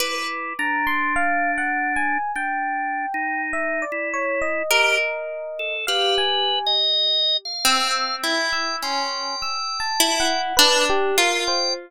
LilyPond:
<<
  \new Staff \with { instrumentName = "Orchestral Harp" } { \time 5/4 \tempo 4 = 51 b'1 bes'4 | g'4. c'8 e'8 des'8 r8 e'8 d'8 f'8 | }
  \new Staff \with { instrumentName = "Drawbar Organ" } { \time 5/4 e'8 d'4. \tuplet 3/2 { d'4 ees'4 e'4 } g'16 r8 a'16 | \tuplet 3/2 { b'4 ees''4 f''4 } g''8 g''4. r8. g''16 | }
  \new Staff \with { instrumentName = "Electric Piano 1" } { \time 5/4 d'''8 bes''16 c'''16 \tuplet 3/2 { f''8 ges''8 aes''8 } g''4 e''16 d''16 des''16 ees''4~ ees''16 | f''16 aes''8 r8. e'''8 r16 e'''16 c'''8 \tuplet 3/2 { e'''8 a''8 ges''8 } b'16 g'16 bes'16 c''16 | }
>>